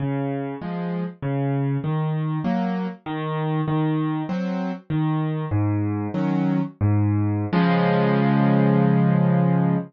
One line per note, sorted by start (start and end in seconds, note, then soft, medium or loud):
0.00 0.55 C#3 medium
0.61 1.04 F3 medium
0.61 1.04 G#3 medium
1.22 1.78 C#3 medium
1.84 2.39 D#3 medium
2.44 2.87 F#3 medium
2.44 2.87 A#3 medium
3.06 3.61 D#3 medium
3.68 4.23 D#3 medium
4.29 4.72 F#3 medium
4.29 4.72 C4 medium
4.90 5.45 D#3 medium
5.51 6.08 G#2 medium
6.14 6.61 D#3 medium
6.14 6.61 F#3 medium
6.14 6.61 C#4 medium
6.81 7.45 G#2 medium
7.53 9.76 C#3 medium
7.53 9.76 F3 medium
7.53 9.76 G#3 loud